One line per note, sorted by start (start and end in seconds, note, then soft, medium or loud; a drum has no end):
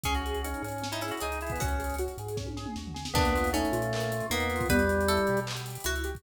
0.03 0.54 C#2 medium
0.03 0.22 C#4 medium
0.03 0.72 C#4 medium
0.03 0.14 G#4 medium
0.03 kick medium
0.03 closed hi-hat medium
0.15 0.42 F#4 medium
0.15 closed hi-hat medium
0.26 0.43 G#4 medium
0.26 closed hi-hat medium
0.34 closed hi-hat medium
0.44 0.62 C#4 medium
0.44 0.63 D#4 medium
0.44 closed hi-hat medium
0.54 closed hi-hat medium
0.62 1.12 G#2 medium
0.62 0.88 C#4 medium
0.62 0.80 G#4 medium
0.62 closed hi-hat medium
0.68 closed hi-hat medium
0.72 closed hi-hat medium
0.78 0.99 C#4 medium
0.78 closed hi-hat medium
0.84 snare medium
0.92 1.02 D#4 medium
0.92 1.01 E4 medium
0.92 closed hi-hat medium
1.01 1.11 C#4 medium
1.01 1.19 E4 medium
1.01 1.21 G#4 medium
1.01 closed hi-hat medium
1.08 1.20 F#4 medium
1.08 closed hi-hat medium
1.11 closed hi-hat medium
1.17 closed hi-hat medium
1.20 1.55 C#2 medium
1.20 1.38 D#4 medium
1.20 1.39 D#4 medium
1.20 1.54 G#4 medium
1.20 closed hi-hat medium
1.32 closed hi-hat medium
1.41 1.51 E4 medium
1.41 1.58 G#4 medium
1.41 closed hi-hat medium
1.47 closed hi-hat medium
1.50 1.61 B3 medium
1.50 kick medium
1.50 closed hi-hat medium
1.55 2.08 C#2 medium
1.55 1.77 C#4 medium
1.55 closed hi-hat medium
1.60 1.96 C#4 medium
1.60 2.41 F#4 medium
1.60 kick medium
1.60 closed hi-hat medium
1.68 closed hi-hat medium
1.79 1.96 G#4 medium
1.79 closed hi-hat medium
1.84 closed hi-hat medium
1.90 closed hi-hat medium
1.94 closed hi-hat medium
1.98 2.17 F#4 medium
1.98 closed hi-hat medium
2.08 closed hi-hat medium
2.18 2.67 G#2 medium
2.18 2.37 G#4 medium
2.18 closed hi-hat medium
2.28 closed hi-hat medium
2.37 2.54 C#4 medium
2.37 kick medium
2.37 snare medium
2.47 high tom medium
2.57 2.74 G#4 medium
2.57 snare medium
2.66 mid tom medium
2.76 3.09 D#2 medium
2.76 2.95 F#4 medium
2.76 snare medium
2.87 floor tom medium
2.94 3.12 G#4 medium
2.94 snare medium
3.05 snare medium
3.14 3.64 D#2 loud
3.14 3.32 A#3 medium
3.14 3.50 B3 loud
3.14 3.52 D4 loud
3.14 kick loud
3.14 crash medium
3.25 closed hi-hat medium
3.35 3.52 F4 medium
3.35 closed hi-hat medium
3.37 closed hi-hat medium
3.44 closed hi-hat medium
3.47 closed hi-hat medium
3.53 4.26 A3 medium
3.53 4.25 C#4 loud
3.53 3.71 D#4 medium
3.53 closed hi-hat medium
3.65 closed hi-hat medium
3.72 4.22 A#2 medium
3.72 3.90 F4 medium
3.72 closed hi-hat medium
3.82 closed hi-hat medium
3.93 4.11 A#3 medium
3.93 clap loud
4.00 closed hi-hat medium
4.12 4.29 F4 medium
4.12 closed hi-hat medium
4.20 closed hi-hat medium
4.30 4.63 E2 medium
4.30 4.67 A#3 loud
4.30 4.67 B3 medium
4.30 4.47 D#4 medium
4.30 closed hi-hat medium
4.40 closed hi-hat medium
4.50 4.68 F4 medium
4.50 closed hi-hat medium
4.56 closed hi-hat medium
4.60 kick medium
4.60 closed hi-hat medium
4.66 kick medium
4.66 closed hi-hat medium
4.70 5.19 E2 loud
4.70 5.40 G3 loud
4.70 4.88 B3 medium
4.70 5.03 B4 loud
4.70 closed hi-hat medium
4.79 closed hi-hat medium
4.88 5.05 G4 medium
4.88 closed hi-hat medium
5.01 closed hi-hat medium
5.08 5.27 E4 medium
5.08 5.78 A4 loud
5.08 closed hi-hat medium
5.17 closed hi-hat medium
5.27 5.78 B2 medium
5.27 5.46 G4 medium
5.27 closed hi-hat medium
5.37 closed hi-hat medium
5.47 5.64 B3 medium
5.47 clap loud
5.56 closed hi-hat medium
5.66 5.84 G4 medium
5.66 closed hi-hat medium
5.70 closed hi-hat medium
5.75 closed hi-hat medium
5.80 closed hi-hat medium
5.84 6.18 C#2 medium
5.84 6.02 E4 medium
5.84 6.18 F#4 loud
5.84 closed hi-hat loud
5.96 closed hi-hat medium
6.04 6.22 G4 medium
6.04 closed hi-hat medium
6.15 kick medium
6.15 snare soft
6.15 closed hi-hat medium